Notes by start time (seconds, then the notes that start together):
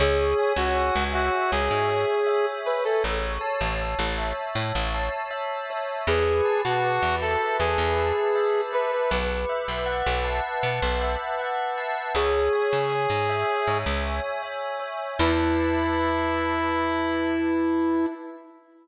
0.00 C#2 G#4 C#5
0.39 G#5
0.56 C#2 F#4
0.75 C#5
0.96 C#2
1.13 F#4 E5
1.52 C#2 G#4 C#5
1.71 G#2
1.90 G#5
2.27 E5
2.66 B4 C#5
2.85 A4
3.04 A1 C#5
3.41 A5
3.61 A1
3.81 C#5
3.99 A1
4.18 E5
4.55 A2 C#5
4.75 A1
4.94 A5
5.31 E5
5.70 C#5
6.07 E2 G#4 B4
6.45 A5
6.64 B2 F#4
6.84 B4
7.02 E2
7.22 A4 E5
7.59 E2 G#4 B4
7.78 E2
7.98 A5
8.35 E5
8.73 B4
8.92 B4
9.11 B1 B4
9.49 E5
9.68 B1
9.86 F#5
10.06 B1
10.24 A5
10.63 B2 B4
10.82 B1
11.01 E5
11.39 F#5
11.78 A5
12.15 C#2 G#4 C#5
12.53 G#5
12.73 C#3
12.92 C#5
13.10 G#2
13.29 E5
13.67 G#2 C#5
13.86 C#2
14.05 G#5
14.43 E5
14.79 C#5
15.19 E2 E4 B4 E5 A5